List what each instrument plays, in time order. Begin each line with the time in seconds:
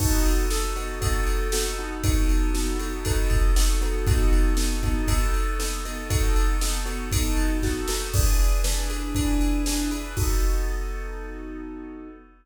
0.00 acoustic grand piano B3 D#4 F#4 A4, kick, crash
0.25 ride
0.50 acoustic grand piano B3 D#4 F#4 A4, snare
0.76 acoustic grand piano B3 D#4 F#4 A4, ride
1.01 acoustic grand piano B3 D#4 F#4 A4, kick, ride
1.27 ride
1.52 acoustic grand piano B3 D#4 F#4 A4, snare
1.78 acoustic grand piano B3 D#4 F#4 A4
2.03 acoustic grand piano B3 D#4 F#4 A4, kick, ride
2.29 ride
2.54 acoustic grand piano B3 D#4 F#4 A4, snare
2.79 acoustic grand piano B3 D#4 F#4 A4, ride
3.05 acoustic grand piano B3 D#4 F#4 A4, kick, ride
3.30 kick, ride
3.56 acoustic grand piano B3 D#4 F#4 A4, snare
3.81 acoustic grand piano B3 D#4 F#4 A4, ride
4.07 acoustic grand piano B3 D#4 F#4 A4, kick, ride
4.33 ride
4.57 acoustic grand piano B3 D#4 F#4 A4, snare
4.83 acoustic grand piano B3 D#4 F#4 A4, kick, ride
5.08 acoustic grand piano B3 D#4 F#4 A4, kick, ride
5.34 ride
5.59 acoustic grand piano B3 D#4 F#4 A4, snare
5.85 acoustic grand piano B3 D#4 F#4 A4, ride
6.10 acoustic grand piano B3 D#4 F#4 A4, kick, ride
6.36 ride
6.61 acoustic grand piano B3 D#4 F#4 A4, snare
6.86 acoustic grand piano B3 D#4 F#4 A4, ride
7.12 acoustic grand piano B3 D#4 F#4 A4, kick, ride
7.37 ride
7.63 acoustic grand piano B3 D#4 F#4 A4, kick, snare
7.88 acoustic grand piano B3 D#4 F#4 A4, snare
8.14 acoustic grand piano E3 D4 G#4 B4, kick, crash
8.39 ride
8.64 acoustic grand piano E3 D4 G#4 B4, snare
8.90 acoustic grand piano E3 D4 G#4 B4, ride
9.15 acoustic grand piano E3 D4 G#4 B4, kick, ride
9.41 ride
9.66 acoustic grand piano E3 D4 G#4 B4, snare
9.91 acoustic grand piano E3 D4 G#4 B4, ride
10.17 acoustic grand piano B3 D#4 F#4 A4, kick, crash